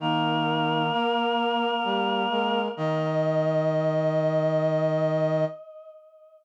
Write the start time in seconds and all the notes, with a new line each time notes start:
0.00 D#3 A#3 D#4 A#4
0.92 A#3 A#4
1.84 G3 G4
2.30 G#3 A#4
2.77 D#3 D#5